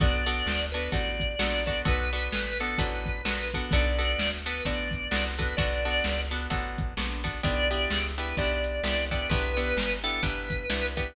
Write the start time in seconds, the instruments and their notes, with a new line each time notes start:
0.00 electric bass (finger) B1, acoustic guitar (steel) B3 D4 F#4 A4, drawbar organ D5, kick, closed hi-hat
0.26 acoustic guitar (steel) B3 D4 F#4 A4, closed hi-hat
0.46 electric bass (finger) D2, snare
0.72 acoustic guitar (steel) B3 D4 F#4 A4, drawbar organ B4, closed hi-hat
0.92 electric bass (finger) A1, acoustic guitar (steel) B3 D4 F#4 A4, drawbar organ D5, kick, closed hi-hat
1.20 kick, closed hi-hat
1.39 electric bass (finger) A#1, acoustic guitar (steel) B3 D4 F#4 A4, snare
1.66 acoustic guitar (steel) B3 D4 F#4 A4, drawbar organ D5, kick, closed hi-hat
1.85 electric bass (finger) B1, acoustic guitar (steel) B3 D4 F#4 A4, drawbar organ B4, kick, closed hi-hat
2.13 acoustic guitar (steel) B3 D4 F#4 A4, closed hi-hat
2.32 electric bass (finger) A1, snare
2.60 acoustic guitar (steel) B3 D4 F#4 A4, drawbar organ A4, closed hi-hat
2.78 electric bass (finger) A1, acoustic guitar (steel) B3 D4 F#4 A4, drawbar organ B4, kick, closed hi-hat
3.06 kick, closed hi-hat
3.25 electric bass (finger) A#1, acoustic guitar (steel) B3 D4 F#4 A4, snare
3.52 acoustic guitar (steel) B3 D4 F#4 A4, kick, closed hi-hat
3.71 electric bass (finger) B1, acoustic guitar (steel) B3 D4 F#4 A4, drawbar organ D5, kick, closed hi-hat
3.99 acoustic guitar (steel) B3 D4 F#4 A4, closed hi-hat
4.19 electric bass (finger) D2, snare
4.46 acoustic guitar (steel) B3 D4 F#4 A4, drawbar organ B4, closed hi-hat
4.65 electric bass (finger) A1, acoustic guitar (steel) B3 D4 F#4 A4, drawbar organ D5, kick, closed hi-hat
4.91 kick, closed hi-hat
5.11 electric bass (finger) C2, acoustic guitar (steel) B3 D4 F#4 A4, snare
5.38 acoustic guitar (steel) B3 D4 F#4 A4, drawbar organ B4, kick, closed hi-hat
5.57 electric bass (finger) B1, acoustic guitar (steel) B3 D4 F#4 A4, drawbar organ D5, kick, closed hi-hat
5.85 acoustic guitar (steel) B3 D4 F#4 A4
6.04 electric bass (finger) C#2, snare, closed hi-hat
6.31 acoustic guitar (steel) B3 D4 F#4 A4, closed hi-hat
6.50 electric bass (finger) A1, acoustic guitar (steel) B3 D4 F#4 A4, kick, closed hi-hat
6.78 kick, closed hi-hat
6.97 electric bass (finger) A#1, acoustic guitar (steel) B3 D4 F#4 A4, snare
7.24 acoustic guitar (steel) B3 D4 F#4 A4, kick, open hi-hat
7.43 electric bass (finger) B1, acoustic guitar (steel) B3 D4 E4 G4, drawbar organ D5, kick, closed hi-hat
7.71 acoustic guitar (steel) B3 D4 E4 G4, closed hi-hat
7.90 electric bass (finger) C#2, snare
8.18 acoustic guitar (steel) B3 D4 E4 G4, drawbar organ B4, closed hi-hat
8.37 electric bass (finger) B1, acoustic guitar (steel) B3 D4 E4 G4, drawbar organ D5, kick, closed hi-hat
8.64 closed hi-hat
8.84 electric bass (finger) C2, acoustic guitar (steel) B3 D4 E4 G4, snare
9.11 acoustic guitar (steel) B3 D4 E4 G4, drawbar organ D5, kick, closed hi-hat
9.29 electric bass (finger) B1, acoustic guitar (steel) B3 D4 E4 G4, drawbar organ B4, kick, closed hi-hat
9.57 acoustic guitar (steel) B3 D4 E4 G4, closed hi-hat
9.77 electric bass (finger) G1, snare
10.04 acoustic guitar (steel) B3 D4 E4 G4, drawbar organ A4, closed hi-hat
10.22 electric bass (finger) G1, acoustic guitar (steel) B3 D4 E4 G4, drawbar organ B4, kick, closed hi-hat
10.50 kick, closed hi-hat
10.70 electric bass (finger) C2, acoustic guitar (steel) B3 D4 E4 G4, snare
10.97 acoustic guitar (steel) B3 D4 E4 G4, drawbar organ B4, kick, closed hi-hat